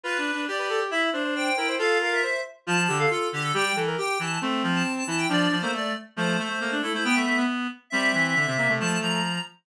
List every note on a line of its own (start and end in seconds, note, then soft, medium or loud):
0.03 0.17 F4 medium
0.03 0.45 B4 medium
0.03 0.41 B4 medium
0.18 0.31 D4 medium
0.33 0.47 D4 medium
0.47 0.84 G4 medium
0.47 0.57 D5 medium
0.58 0.69 B4 medium
0.58 0.68 D5 medium
0.69 0.80 A4 medium
0.69 0.79 D5 medium
0.80 0.91 G4 medium
0.91 1.10 E4 medium
0.91 1.01 E5 medium
0.91 1.09 E5 loud
1.13 1.50 D4 medium
1.13 1.23 C5 medium
1.24 1.34 C5 medium
1.35 1.56 C5 medium
1.35 1.73 G5 loud
1.57 1.76 E4 medium
1.57 1.67 A#4 medium
1.68 1.78 C5 medium
1.78 2.21 F4 medium
1.78 1.98 A4 loud
1.78 1.98 F5 loud
2.01 2.11 A#4 medium
2.01 2.12 F5 medium
2.12 2.22 A#4 medium
2.12 2.39 E5 loud
2.23 2.41 C5 medium
2.67 2.87 F3 medium
2.67 2.77 F4 loud
2.67 2.96 A5 loud
2.88 3.06 D3 medium
2.88 2.98 G4 medium
2.98 3.10 A4 medium
2.98 3.09 F5 loud
3.10 3.28 F4 medium
3.10 3.28 A4 medium
3.32 3.52 D3 medium
3.32 3.43 G4 loud
3.42 3.52 A4 loud
3.54 3.72 G3 medium
3.54 3.64 G4 loud
3.54 3.76 G5 loud
3.76 3.95 E3 medium
3.76 3.86 A4 medium
3.87 3.97 A#4 medium
3.98 4.18 G4 medium
3.98 4.18 G5 loud
4.19 4.38 E3 medium
4.19 4.39 A5 medium
4.41 4.62 A3 medium
4.41 5.04 C4 loud
4.63 4.83 F3 medium
4.74 4.92 A5 medium
4.97 5.07 A5 loud
5.07 5.26 E3 medium
5.07 5.28 E4 medium
5.07 5.18 A5 loud
5.18 5.28 G5 loud
5.29 5.47 F3 medium
5.29 5.56 D4 medium
5.29 5.60 D5 loud
5.51 5.61 F3 medium
5.60 5.93 A3 medium
5.60 5.72 A#3 loud
5.60 5.71 C5 loud
5.73 5.92 A3 medium
5.73 5.93 D5 medium
6.16 6.37 F3 medium
6.16 6.37 A3 loud
6.16 6.75 C5 loud
6.38 6.49 A3 medium
6.38 6.59 A3 medium
6.49 6.60 A3 medium
6.60 6.80 A3 medium
6.60 6.71 A#3 medium
6.71 6.82 D4 medium
6.82 6.93 A3 medium
6.82 6.93 E4 medium
6.82 6.92 A4 medium
6.93 7.04 A3 medium
6.93 7.04 E4 medium
6.93 7.04 C5 medium
7.04 7.15 B3 medium
7.04 7.45 B3 medium
7.04 7.15 G5 loud
7.14 7.25 A3 medium
7.14 7.42 E5 loud
7.26 7.36 A3 medium
7.37 7.67 B3 medium
7.90 8.11 G3 medium
7.90 8.35 C4 medium
7.90 8.71 E5 loud
8.14 8.35 E3 medium
8.36 8.46 D3 medium
8.47 8.57 C3 medium
8.47 8.57 C4 medium
8.57 8.68 C3 medium
8.57 8.68 A#3 medium
8.69 8.79 C3 medium
8.69 8.79 A3 medium
8.80 8.98 F3 medium
8.80 9.20 A3 loud
8.80 8.99 A5 loud
9.01 9.39 F3 medium
9.01 9.40 A#5 loud